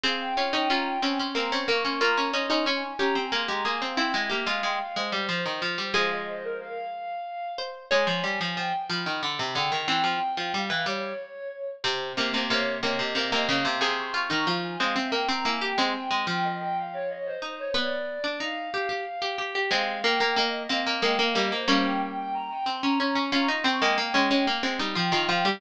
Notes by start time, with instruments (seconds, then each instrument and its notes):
0.04 pizzicato strings C4 G#4, flute F5
0.21 flute G5
0.37 pizzicato strings C#4 F4, flute G5
0.53 pizzicato strings C#4 D#4, flute G5
0.70 pizzicato strings C#4 F4, flute A#5
0.86 flute G5
1.02 pizzicato strings C4 C#4, flute G#5
1.19 pizzicato strings C#4, flute C6
1.35 pizzicato strings A#3 C4, flute A#5
1.52 pizzicato strings C4 C#4, flute C#6
1.68 pizzicato strings A#3, flute C#6
1.85 pizzicato strings C#4, flute C6
2.01 pizzicato strings A#3 F4, flute A#5
2.17 pizzicato strings C#4
2.33 pizzicato strings C#4 D#4, flute C6
2.50 pizzicato strings C#4 D#4, flute C6
2.66 pizzicato strings C#4, flute G#5
2.99 pizzicato strings C#4 G4, flute A#5
3.15 pizzicato strings C4, flute G#5
3.32 pizzicato strings A#3 G#4, flute C6
3.48 pizzicato strings G#3 G4, flute A#5
3.65 pizzicato strings A#3 G#4, flute G#5
3.81 pizzicato strings C4, flute F5
3.97 pizzicato strings C4 E4, flute G5
4.14 pizzicato strings G#3 E4, flute E5
4.30 pizzicato strings A#3 G4, flute E5
4.46 pizzicato strings G#3 F4, flute F5
4.63 pizzicato strings G#3, flute G5
4.80 flute F5
4.96 pizzicato strings G#3, flute C5
5.12 pizzicato strings G3
5.29 pizzicato strings F3, flute C5
5.46 pizzicato strings D#3
5.62 pizzicato strings F3
5.78 pizzicato strings G3
5.94 pizzicato strings F3 G#3 G#4, flute F5
6.11 flute D#5
6.27 flute C5
6.44 flute A#4
6.60 flute F5
7.58 pizzicato strings C5
7.91 pizzicato strings G#3 C#5, flute G#5
8.07 pizzicato strings F3
8.24 pizzicato strings G3, flute G#5
8.40 pizzicato strings F3, flute G#5
8.57 pizzicato strings F3, flute G5
8.89 pizzicato strings F3, flute B5
9.06 pizzicato strings D#3
9.22 pizzicato strings D3, flute B5
9.39 pizzicato strings C3
9.55 pizzicato strings D3 G#4, flute G5
9.72 pizzicato strings D#3
9.88 pizzicato strings E3 C4, flute G5
10.04 pizzicato strings F3
10.37 pizzicato strings F3
10.53 pizzicato strings G3, flute F5
10.70 pizzicato strings E3
10.86 pizzicato strings G3, flute C#5
11.84 pizzicato strings C3 C4, flute C5
12.17 pizzicato strings C3 A#3
12.34 pizzicato strings C3 A#3
12.50 pizzicato strings C3 A#3, flute C#5
12.83 pizzicato strings C3 A#3, flute D#5
12.99 pizzicato strings C3
13.15 pizzicato strings C3 A#3, flute D#5
13.32 pizzicato strings C3 A#3, flute D#5
13.48 pizzicato strings C#3 A#3, flute F5
13.65 pizzicato strings C3
13.81 pizzicato strings C3 G#4, flute C6
13.98 flute C#6
14.14 pizzicato strings F4, flute C#6
14.30 pizzicato strings D#3 D#4, flute A#5
14.47 pizzicato strings F3 F4
14.63 flute G#5
14.80 pizzicato strings G#3 C4, flute F5
14.96 pizzicato strings C4, flute E5
15.12 pizzicato strings A#3, flute G5
15.29 pizzicato strings C4, flute A#5
15.45 pizzicato strings A#3 E4, flute G#5
15.61 pizzicato strings G4, flute G5
15.78 pizzicato strings G#3 C4, flute G#5
15.95 flute G5
16.11 pizzicato strings G#3, flute G5
16.27 pizzicato strings F3, flute G5
16.43 flute D#5
16.60 flute G5
16.76 flute F5
16.93 flute C#5
17.09 flute D#5
17.26 flute C5
17.42 pizzicato strings D#4, flute C5
17.58 flute C#5
17.74 pizzicato strings B3 B4, flute D5
18.24 pizzicato strings D4
18.40 pizzicato strings D#4, flute F5
18.74 pizzicato strings G4
18.89 pizzicato strings G4
19.22 pizzicato strings G4
19.38 pizzicato strings G4
19.55 pizzicato strings G4
19.71 pizzicato strings G#3 C4, flute F5
20.04 pizzicato strings A#3, flute G5
20.20 pizzicato strings A#3, flute G5
20.36 pizzicato strings A#3, flute D#5
20.69 pizzicato strings A#3 C4, flute F5
20.86 pizzicato strings A#3, flute D#5
21.02 pizzicato strings G#3 A#3, flute G5
21.19 pizzicato strings A#3, flute F5
21.35 pizzicato strings G3 A#3, flute D#5
21.52 pizzicato strings A#3, flute C5
21.68 pizzicato strings G3 A#3 C#4, flute F5
21.85 flute G5
22.01 flute G5
22.17 flute G5
22.34 flute A#5
22.50 flute G5
22.66 pizzicato strings C4, flute C6
22.83 pizzicato strings C#4, flute A#5
22.99 pizzicato strings C#4, flute A#5
23.15 pizzicato strings C#4, flute C#6
23.32 pizzicato strings C#4 F4, flute A#5
23.48 pizzicato strings D#4, flute C#6
23.64 pizzicato strings C4, flute G5
23.82 pizzicato strings G#3 A#3
23.98 pizzicato strings A#3
24.14 pizzicato strings G#3 C#4
24.31 pizzicato strings G#3 C#4
24.47 pizzicato strings A#3
24.63 pizzicato strings G#3 C4
24.79 pizzicato strings G3 D#4
24.95 pizzicato strings F3 F4, flute G5
25.12 pizzicato strings D#3 F4, flute G5
25.29 pizzicato strings F3 F4, flute G5
25.45 pizzicato strings G3 G4